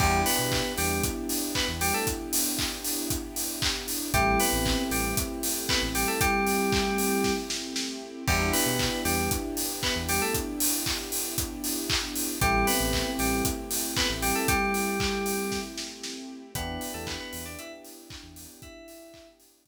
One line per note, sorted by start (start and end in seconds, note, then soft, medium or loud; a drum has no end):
0.00 0.23 E2 medium
0.00 0.21 G3 medium
0.00 3.72 B3 medium
0.00 4.10 B3 medium
0.00 3.72 D4 medium
0.00 4.10 D4 medium
0.00 3.72 E4 medium
0.00 4.10 E4 medium
0.00 0.21 G4 loud
0.00 3.72 G4 medium
0.00 4.10 G4 medium
0.00 kick loud
0.00 crash loud
0.26 0.73 B3 medium
0.26 0.73 B4 medium
0.26 open hi-hat medium
0.39 0.62 B2 medium
0.52 kick medium
0.52 clap loud
0.78 1.01 E2 medium
0.78 1.03 G3 medium
0.78 1.03 G4 medium
0.78 open hi-hat medium
1.03 kick loud
1.03 closed hi-hat loud
1.29 open hi-hat medium
1.55 1.68 B3 medium
1.55 1.68 B4 medium
1.55 kick medium
1.55 clap loud
1.68 1.91 E2 medium
1.81 1.93 G3 medium
1.81 1.93 G4 medium
1.81 open hi-hat medium
1.94 2.06 A3 medium
1.94 2.06 A4 medium
2.07 kick medium
2.07 closed hi-hat loud
2.33 open hi-hat loud
2.59 kick medium
2.59 clap loud
2.84 open hi-hat medium
3.10 kick medium
3.10 closed hi-hat loud
3.36 open hi-hat medium
3.62 kick medium
3.62 clap loud
3.88 open hi-hat medium
4.14 4.37 A1 medium
4.14 4.39 G3 loud
4.14 7.86 A3 medium
4.14 8.24 A3 medium
4.14 7.86 C4 medium
4.14 8.24 C4 medium
4.14 7.86 E4 medium
4.14 8.24 E4 medium
4.14 4.39 G4 loud
4.14 7.86 G4 medium
4.14 8.24 G4 medium
4.14 kick loud
4.14 closed hi-hat loud
4.40 4.83 B3 medium
4.40 4.83 B4 medium
4.40 open hi-hat medium
4.53 4.76 A1 medium
4.66 kick medium
4.66 clap loud
4.91 5.14 A1 medium
4.91 5.15 G3 medium
4.91 5.15 G4 medium
4.91 open hi-hat medium
5.17 kick loud
5.17 closed hi-hat loud
5.43 open hi-hat medium
5.69 5.82 B3 medium
5.69 5.82 B4 medium
5.69 kick medium
5.69 clap loud
5.82 6.05 A1 medium
5.95 6.07 G3 medium
5.95 6.07 G4 medium
5.95 open hi-hat medium
6.08 6.20 A3 medium
6.08 6.20 A4 medium
6.21 7.32 G3 loud
6.21 7.32 G4 loud
6.21 kick loud
6.21 closed hi-hat loud
6.47 open hi-hat medium
6.72 kick loud
6.72 clap loud
6.98 open hi-hat medium
7.24 kick medium
7.24 snare medium
7.50 snare medium
7.76 snare medium
8.28 8.51 E2 medium
8.28 8.48 G3 medium
8.28 12.00 B3 medium
8.28 12.39 B3 medium
8.28 12.00 D4 medium
8.28 12.39 D4 medium
8.28 12.00 E4 medium
8.28 12.39 E4 medium
8.28 8.48 G4 loud
8.28 12.00 G4 medium
8.28 12.39 G4 medium
8.28 kick loud
8.28 crash loud
8.53 9.00 B3 medium
8.53 9.00 B4 medium
8.53 open hi-hat medium
8.66 8.89 B2 medium
8.79 kick medium
8.79 clap loud
9.05 9.29 E2 medium
9.05 9.30 G3 medium
9.05 9.30 G4 medium
9.05 open hi-hat medium
9.31 kick loud
9.31 closed hi-hat loud
9.57 open hi-hat medium
9.83 9.95 B3 medium
9.83 9.95 B4 medium
9.83 kick medium
9.83 clap loud
9.96 10.19 E2 medium
10.09 10.21 G3 medium
10.09 10.21 G4 medium
10.09 open hi-hat medium
10.22 10.34 A3 medium
10.22 10.34 A4 medium
10.34 kick medium
10.34 closed hi-hat loud
10.60 open hi-hat loud
10.86 kick medium
10.86 clap loud
11.12 open hi-hat medium
11.38 kick medium
11.38 closed hi-hat loud
11.64 open hi-hat medium
11.90 kick medium
11.90 clap loud
12.16 open hi-hat medium
12.41 12.65 A1 medium
12.41 12.67 G3 loud
12.41 16.14 A3 medium
12.41 16.52 A3 medium
12.41 16.14 C4 medium
12.41 16.52 C4 medium
12.41 16.14 E4 medium
12.41 16.52 E4 medium
12.41 16.14 G4 medium
12.41 12.67 G4 loud
12.41 16.52 G4 medium
12.41 kick loud
12.41 closed hi-hat loud
12.67 13.11 B3 medium
12.67 13.11 B4 medium
12.67 open hi-hat medium
12.80 13.04 A1 medium
12.93 kick medium
12.93 clap loud
13.19 13.42 A1 medium
13.19 13.43 G3 medium
13.19 13.43 G4 medium
13.19 open hi-hat medium
13.45 kick loud
13.45 closed hi-hat loud
13.71 open hi-hat medium
13.97 14.09 B3 medium
13.97 14.09 B4 medium
13.97 kick medium
13.97 clap loud
14.09 14.33 A1 medium
14.22 14.35 G3 medium
14.22 14.35 G4 medium
14.22 open hi-hat medium
14.35 14.48 A3 medium
14.35 14.48 A4 medium
14.48 15.59 G3 loud
14.48 15.59 G4 loud
14.48 kick loud
14.48 closed hi-hat loud
14.74 open hi-hat medium
15.00 kick loud
15.00 clap loud
15.26 open hi-hat medium
15.52 kick medium
15.52 snare medium
15.78 snare medium
16.03 snare medium
16.54 16.78 E2 medium
16.54 19.68 B3 medium
16.54 16.92 B3 medium
16.54 19.68 D4 medium
16.54 19.68 E4 medium
16.54 19.68 G4 medium
16.54 16.92 B4 medium
16.54 kick loud
16.54 closed hi-hat loud
16.81 open hi-hat medium
16.94 17.18 E2 medium
16.94 17.06 A3 medium
16.94 17.06 A4 medium
17.07 17.19 B3 medium
17.07 17.19 B4 medium
17.07 kick medium
17.07 clap loud
17.20 17.44 B3 medium
17.20 17.44 B4 medium
17.33 17.56 E2 medium
17.33 open hi-hat medium
17.45 17.58 D4 medium
17.45 17.58 D5 medium
17.59 17.71 E4 medium
17.59 17.71 E5 medium
17.59 closed hi-hat loud
17.84 open hi-hat medium
18.10 kick loud
18.10 clap loud
18.23 18.47 E2 medium
18.36 open hi-hat medium
18.62 19.28 E4 medium
18.62 19.28 E5 medium
18.62 kick loud
18.62 closed hi-hat medium
18.88 open hi-hat medium
19.14 kick medium
19.14 clap loud
19.40 open hi-hat medium
19.66 kick medium
19.66 closed hi-hat loud